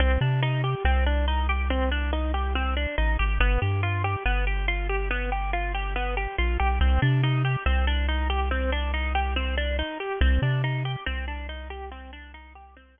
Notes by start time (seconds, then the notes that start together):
0.00 C2 C4
0.21 C3 D4
0.43 D#4
0.64 G4
0.85 C2 C4
1.06 D4
1.28 D#4
1.49 G4
1.70 C4
1.91 D4
2.13 D#4
2.34 G4
2.55 C4
2.77 D4
2.98 A1 D#4
3.19 G#1 G4
3.40 G1 B3
3.62 G2 G4
3.83 F4
4.04 G4
4.26 G1 B3
4.47 G4
4.68 F4
4.89 G4
5.11 B3
5.32 G4
5.53 F4
5.74 G4
5.96 B3
6.17 G4
6.38 A#1 F4
6.60 B1 G4
6.81 C2 C4
7.02 C3 D4
7.23 D#4
7.45 G4
7.66 C2 C4
7.87 D4
8.09 D#4
8.30 G4
8.51 C4
8.72 D4
8.94 D#4
9.15 G4
9.36 C4
9.57 D4
9.79 D#4
10.00 G4
10.21 C2 C4
10.42 C3 D4
10.64 D#4
10.85 G4
11.06 C2 C4
11.28 D4
11.49 D#4
11.70 G4
11.91 C4
12.13 D4
12.34 D#4
12.55 G4
12.77 C4
12.98 D4